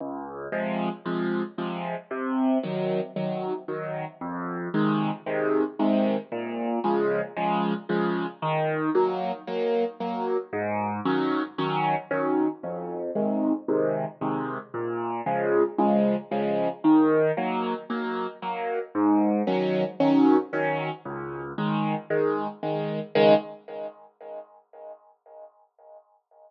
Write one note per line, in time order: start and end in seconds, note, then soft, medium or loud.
0.00 0.48 C#2 medium
0.52 0.89 C3 medium
0.52 0.89 F3 medium
0.52 0.89 G#3 medium
1.06 1.42 C3 medium
1.06 1.42 F3 medium
1.06 1.42 G#3 medium
1.58 1.95 C3 medium
1.58 1.95 F3 medium
1.58 1.95 G#3 medium
2.11 2.58 C3 medium
2.63 3.00 D#3 medium
2.63 3.00 F#3 medium
3.16 3.53 D#3 medium
3.16 3.53 F#3 medium
3.68 4.05 D#3 medium
3.68 4.05 F#3 medium
4.21 4.69 F2 medium
4.74 5.11 C3 medium
4.74 5.11 D#3 medium
4.74 5.11 G#3 medium
5.26 5.63 C3 medium
5.26 5.63 D#3 medium
5.26 5.63 G#3 medium
5.79 6.16 C3 medium
5.79 6.16 D#3 medium
5.79 6.16 G#3 medium
6.32 6.79 A#2 medium
6.84 7.21 C#3 medium
6.84 7.21 F3 medium
6.84 7.21 G#3 medium
7.37 7.73 C#3 medium
7.37 7.73 F3 medium
7.37 7.73 G#3 medium
7.89 8.26 C#3 medium
7.89 8.26 F3 medium
7.89 8.26 G#3 medium
8.42 8.90 D#3 medium
8.95 9.32 F#3 medium
8.95 9.32 A#3 medium
9.47 9.84 F#3 medium
9.47 9.84 A#3 medium
10.00 10.37 F#3 medium
10.00 10.37 A#3 medium
10.53 11.00 G#2 medium
11.05 11.42 D#3 medium
11.05 11.42 F#3 medium
11.05 11.42 C#4 medium
11.58 11.95 D#3 medium
11.58 11.95 F#3 medium
11.58 11.95 C#4 medium
12.11 12.48 D#3 medium
12.11 12.48 F#3 medium
12.11 12.48 C#4 medium
12.63 13.11 F2 medium
13.15 13.52 C3 medium
13.15 13.52 D#3 medium
13.15 13.52 G#3 medium
13.68 14.05 C3 medium
13.68 14.05 D#3 medium
13.68 14.05 G#3 medium
14.21 14.58 C3 medium
14.21 14.58 D#3 medium
14.21 14.58 G#3 medium
14.74 15.21 A#2 medium
15.26 15.63 C#3 medium
15.26 15.63 F3 medium
15.26 15.63 G#3 medium
15.78 16.15 C#3 medium
15.78 16.15 F3 medium
15.78 16.15 G#3 medium
16.31 16.68 C#3 medium
16.31 16.68 F3 medium
16.31 16.68 G#3 medium
16.84 17.31 D#3 medium
17.37 17.74 F#3 medium
17.37 17.74 A#3 medium
17.90 18.27 F#3 medium
17.90 18.27 A#3 medium
18.42 18.79 F#3 medium
18.42 18.79 A#3 medium
18.95 19.42 G#2 medium
19.47 19.84 D#3 medium
19.47 19.84 F#3 medium
19.47 19.84 C#4 medium
20.00 20.37 D#3 medium
20.00 20.37 F#3 medium
20.00 20.37 C#4 medium
20.53 20.90 D#3 medium
20.53 20.90 F#3 medium
20.53 20.90 C#4 medium
21.05 21.53 C#2 medium
21.58 21.95 D#3 medium
21.58 21.95 G#3 medium
22.10 22.47 D#3 medium
22.10 22.47 G#3 medium
22.63 23.00 D#3 medium
22.63 23.00 G#3 medium
23.15 23.34 C#2 loud
23.15 23.34 D#3 medium
23.15 23.34 G#3 loud